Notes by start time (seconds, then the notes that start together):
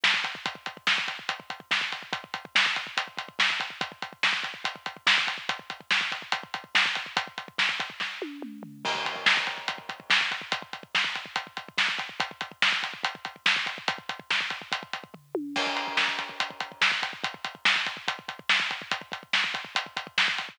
0.04 kick, snare
0.14 kick
0.24 kick, closed hi-hat
0.35 kick
0.46 kick, closed hi-hat
0.55 kick
0.66 kick, closed hi-hat
0.77 kick
0.87 kick, snare
0.98 kick
1.08 kick, closed hi-hat
1.19 kick
1.29 kick, closed hi-hat
1.40 kick
1.50 kick, closed hi-hat
1.60 kick
1.71 kick, snare
1.81 kick
1.92 kick, closed hi-hat
2.03 kick
2.13 kick, closed hi-hat
2.24 kick
2.34 kick, closed hi-hat
2.45 kick
2.55 kick, snare
2.66 kick
2.76 kick, closed hi-hat
2.87 kick
2.97 kick, closed hi-hat
3.08 kick
3.17 kick, closed hi-hat
3.28 kick
3.39 kick, snare
3.50 kick
3.60 kick, closed hi-hat
3.70 kick
3.81 kick, closed hi-hat
3.92 kick
4.02 kick, closed hi-hat
4.13 kick
4.23 kick, snare
4.33 kick
4.43 kick, closed hi-hat
4.54 kick
4.64 kick, closed hi-hat
4.76 kick
4.86 kick, closed hi-hat
4.97 kick
5.07 kick, snare
5.18 kick
5.27 kick, closed hi-hat
5.38 kick
5.49 kick, closed hi-hat
5.59 kick
5.70 kick, closed hi-hat
5.81 kick
5.91 kick, snare
6.01 kick
6.12 kick, closed hi-hat
6.22 kick
6.32 kick, closed hi-hat
6.43 kick
6.54 kick, closed hi-hat
6.64 kick
6.75 kick, snare
6.86 kick
6.95 kick, closed hi-hat
7.06 kick
7.17 kick, closed hi-hat
7.27 kick
7.38 kick, closed hi-hat
7.48 kick
7.58 kick, snare
7.69 kick
7.80 kick, closed hi-hat
7.90 kick
8.00 kick, snare
8.22 high tom
8.42 mid tom
8.63 floor tom
8.85 kick, crash
8.95 kick
9.05 kick, closed hi-hat
9.16 kick
9.26 kick, snare
9.37 kick
9.47 kick, closed hi-hat
9.58 kick
9.68 kick, closed hi-hat
9.78 kick
9.89 kick, closed hi-hat
10.00 kick
10.10 kick, snare
10.21 kick
10.31 kick, closed hi-hat
10.41 kick
10.52 kick, closed hi-hat
10.62 kick
10.73 kick, closed hi-hat
10.83 kick
10.95 kick, snare
11.04 kick
11.15 kick, closed hi-hat
11.26 kick
11.36 kick, closed hi-hat
11.47 kick
11.57 kick, closed hi-hat
11.69 kick
11.78 kick, snare
11.88 kick
11.99 kick, closed hi-hat
12.09 kick
12.20 kick, closed hi-hat
12.31 kick
12.41 kick, closed hi-hat
12.51 kick
12.62 kick, snare
12.72 kick
12.83 kick, closed hi-hat
12.94 kick
13.03 kick, closed hi-hat
13.15 kick
13.25 kick, closed hi-hat
13.36 kick
13.46 kick, snare
13.56 kick
13.66 kick, closed hi-hat
13.78 kick
13.88 kick, closed hi-hat
13.98 kick
14.09 kick, closed hi-hat
14.19 kick
14.30 kick, snare
14.41 kick
14.50 kick, closed hi-hat
14.62 kick
14.72 kick, closed hi-hat
14.83 kick
14.93 kick, closed hi-hat
15.04 kick
15.14 kick, floor tom
15.35 high tom
15.56 kick, crash
15.67 kick
15.77 closed hi-hat
15.87 kick
15.97 kick, snare
16.08 kick
16.19 kick, closed hi-hat
16.29 kick
16.40 kick, closed hi-hat
16.50 kick
16.60 kick, closed hi-hat
16.72 kick
16.81 kick, snare
16.92 kick
17.03 kick, closed hi-hat
17.13 kick
17.24 kick, closed hi-hat
17.34 kick
17.44 kick, closed hi-hat
17.55 kick
17.65 kick, snare
17.76 kick
17.86 kick, closed hi-hat
17.97 kick
18.08 kick, closed hi-hat
18.19 kick
18.28 kick, closed hi-hat
18.39 kick
18.49 kick, snare
18.60 kick
18.71 kick, closed hi-hat
18.82 kick
18.91 kick, closed hi-hat
19.01 kick
19.12 kick, closed hi-hat
19.23 kick
19.33 kick, snare
19.44 kick
19.54 kick, closed hi-hat
19.65 kick
19.75 kick, closed hi-hat
19.86 kick
19.97 kick, closed hi-hat
20.07 kick
20.18 kick, snare
20.28 kick
20.38 kick, closed hi-hat
20.49 kick